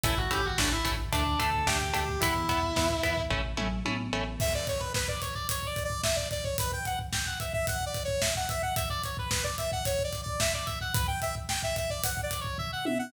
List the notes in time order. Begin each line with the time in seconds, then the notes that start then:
0.04 A1 A3 C#4 E4 E5, kick, closed hi-hat
0.17 F#4 F#5, kick
0.31 A1 A3 C#4 E4 G4 G5, kick, closed hi-hat
0.44 F#4 F#5, kick
0.58 A1 A3 C#4 D4 E4 D5, kick, snare
0.72 E4 E5, kick
0.85 A1 A3 C#4 E4, kick, closed hi-hat
0.99 kick
1.13 D2 A3 D4 D5, kick, closed hi-hat
1.26 kick
1.39 D2 A3 D4 A4 A5, kick, closed hi-hat
1.54 kick
1.66 D2 A3 D4 G4 G5, kick, snare
1.81 G4 G5, kick
1.93 D2 A3 D4 G4 G5, kick, closed hi-hat
2.08 kick
2.20 E2 B3 E4 E5, kick, closed hi-hat
2.35 kick
2.49 E2 B3 E4, kick, closed hi-hat
2.63 kick
2.76 E2 B3 E4, kick, snare
2.90 kick
3.03 E2 B3 E4, kick, closed hi-hat
3.17 kick
3.30 A1 A3 C#4 E4, kick, floor tom
3.57 A1 A3 C#4 E4, mid tom
3.85 A1 A3 C#4 E4, high tom
4.13 A1 A3 C#4 E4
4.40 E5, kick, crash
4.54 D5, kick
4.67 C#5, kick, closed hi-hat
4.80 B4, kick
4.94 B4, kick, snare
5.08 D5, kick
5.22 C#5, kick, closed hi-hat
5.35 D5, kick
5.49 C#5, kick, closed hi-hat
5.63 D5, kick
5.76 kick, closed hi-hat
5.84 D5
5.90 kick
6.03 E5, kick, snare
6.16 D5, kick
6.31 D5, kick, closed hi-hat
6.44 C#5, kick
6.58 B4, kick, closed hi-hat
6.72 G5, kick
6.85 F#5, kick, closed hi-hat
6.99 kick
7.13 G5, kick, snare
7.26 F#5, kick
7.40 E5, kick, closed hi-hat
7.53 E5, kick
7.67 F#5, kick, closed hi-hat
7.81 kick
7.86 D5
7.94 kick, closed hi-hat
8.04 C#5, kick
8.21 E5, kick, snare
8.35 F#5, kick
8.49 E5, kick, closed hi-hat
8.62 F#5, kick
8.76 E5, kick, closed hi-hat
8.90 D5, kick
9.04 C#5, kick, closed hi-hat
9.17 B4, kick
9.31 B4, kick, snare
9.44 D5, kick
9.58 E5, kick, closed hi-hat
9.72 F#5, kick
9.85 C#5, kick, closed hi-hat
9.99 kick
10.04 D5
10.13 kick, closed hi-hat
10.23 D5, kick
10.40 E5, kick, snare
10.54 D5, kick
10.66 E5, kick, closed hi-hat
10.81 F#5, kick
10.94 B4, kick, closed hi-hat
11.07 G5, kick
11.22 E5, kick, closed hi-hat
11.35 kick
11.49 G5, kick, snare
11.63 E5, kick
11.76 E5, kick, closed hi-hat
11.90 D5, kick
12.04 F#5, kick, closed hi-hat
12.17 kick
12.23 D5
12.31 kick, closed hi-hat
12.41 C#5, kick
12.58 E5, kick, floor tom
12.73 F#5
12.85 E5, high tom
12.99 F#5